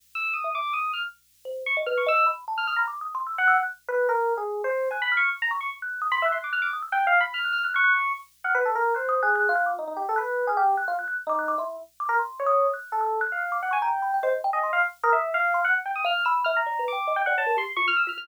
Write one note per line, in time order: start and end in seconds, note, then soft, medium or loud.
0.15 0.33 E6 medium
0.33 0.52 D#6 medium
0.44 0.53 E5 medium
0.55 0.73 D6 medium
0.73 0.91 D#6 medium
0.93 1.02 F6 medium
1.45 1.63 C5 soft
1.66 1.75 C#6 loud
1.76 1.85 D#5 medium
1.86 2.04 B4 medium
1.86 1.95 F6 medium
1.97 2.06 C#6 medium
2.06 2.24 D#5 loud
2.06 2.26 E6 loud
2.26 2.44 B5 soft
2.47 2.66 A5 medium
2.57 2.67 F6 medium
2.67 2.76 D#6 medium
2.67 2.76 F6 loud
2.76 2.85 A#5 medium
2.76 2.87 B5 medium
2.87 2.99 D6 medium
3.01 3.13 D#6 medium
3.15 3.27 C6 medium
3.27 3.36 E6 medium
3.38 3.56 F#5 loud
3.38 3.48 F#6 medium
3.47 3.57 E6 loud
3.58 3.67 F#6 medium
3.88 4.07 B4 loud
3.88 4.07 F#6 medium
4.09 4.33 A#4 loud
4.37 4.61 G#4 medium
4.64 4.88 C5 loud
4.91 5.03 G#5 soft
4.91 5.09 F#6 medium
5.02 5.14 B5 loud
5.11 5.29 F6 medium
5.17 5.29 C#6 medium
5.42 5.51 A#5 loud
5.51 5.60 C#6 medium
5.60 5.69 C#6 medium
5.82 6.00 F#6 medium
6.01 6.11 D#6 loud
6.11 6.21 B5 loud
6.11 6.24 C6 loud
6.22 6.31 E5 medium
6.22 6.38 F#6 medium
6.32 6.41 C6 medium
6.38 6.51 F#6 medium
6.44 6.53 D6 medium
6.52 6.62 F6 medium
6.52 6.71 F#6 loud
6.62 6.71 D6 medium
6.73 6.82 D#6 medium
6.82 6.91 E6 medium
6.92 7.04 G5 loud
6.92 7.19 F#6 medium
7.07 7.19 F5 loud
7.20 7.32 B5 loud
7.34 7.52 F6 medium
7.44 7.53 F#6 medium
7.52 7.61 F6 medium
7.63 7.72 F6 medium
7.63 7.73 F#6 medium
7.74 8.12 C#6 loud
7.74 7.83 F#6 loud
7.83 7.93 F#6 loud
8.44 8.53 F#5 medium
8.44 8.53 F6 medium
8.54 8.64 B4 loud
8.65 8.74 A4 medium
8.75 8.93 A#4 loud
8.94 9.20 C5 medium
8.94 9.07 F#6 medium
9.09 9.21 D#6 loud
9.22 9.47 G#4 medium
9.22 9.35 F#6 loud
9.35 9.54 F#6 loud
9.49 9.73 F4 loud
9.56 9.65 F#6 medium
9.66 9.75 D6 medium
9.78 9.87 D#4 medium
9.87 9.96 D#4 medium
9.96 10.05 G4 medium
10.09 10.18 A4 medium
10.16 10.45 B4 medium
10.16 10.43 F#6 medium
10.47 10.56 G#4 medium
10.47 10.57 F6 medium
10.57 10.75 G4 loud
10.77 10.86 F#6 medium
10.87 10.97 F4 loud
10.98 11.07 F#6 medium
11.07 11.16 F#6 medium
11.27 11.54 D#4 loud
11.27 11.38 D6 loud
11.38 11.47 F#6 medium
11.48 11.57 D6 loud
11.58 11.76 E4 medium
11.58 11.68 C6 medium
12.00 12.09 D6 medium
12.09 12.18 A#4 loud
12.19 12.43 C6 medium
12.39 12.67 C#5 medium
12.46 12.71 D#6 loud
12.73 12.98 F#6 medium
12.92 13.19 A4 medium
13.01 13.19 E6 medium
13.21 13.39 F#6 loud
13.32 13.59 F5 medium
13.51 13.60 D6 medium
13.62 13.71 F#5 medium
13.70 13.82 G#5 medium
13.70 13.80 C#6 medium
13.81 14.18 G5 medium
13.81 13.91 A#5 loud
14.02 14.11 B5 medium
14.14 14.23 G5 medium
14.22 14.32 C5 medium
14.22 14.41 D#5 medium
14.44 14.53 G5 loud
14.53 14.71 D#5 medium
14.53 14.62 G#5 medium
14.63 14.81 C6 medium
14.73 14.82 F5 medium
15.03 15.13 A#4 loud
15.03 15.22 D#6 loud
15.12 15.31 E5 medium
15.34 15.61 F5 loud
15.54 15.63 C6 medium
15.64 15.73 F#5 loud
15.85 15.94 G5 medium
15.95 16.04 D#6 medium
16.04 16.13 F5 loud
16.04 16.24 F6 medium
16.25 16.44 B5 loud
16.25 16.34 E6 medium
16.44 16.54 E5 loud
16.44 16.53 F6 medium
16.56 16.84 A#5 medium
16.66 16.78 D5 medium
16.79 16.91 B4 medium
16.88 17.15 D6 medium
16.92 17.04 G5 medium
17.07 17.16 D#5 medium
17.16 17.25 G5 loud
17.26 17.36 D5 medium
17.26 17.35 F#5 loud
17.37 17.46 C#5 medium
17.37 17.56 A5 loud
17.46 17.55 A#4 medium
17.56 17.66 G4 medium
17.56 17.67 C6 loud
17.76 17.86 F4 medium
17.76 17.85 C#6 loud
17.87 17.97 F6 loud
17.96 18.05 E6 medium
18.07 18.16 F4 medium
18.07 18.17 F6 medium
18.17 18.27 F4 medium
18.17 18.26 F6 loud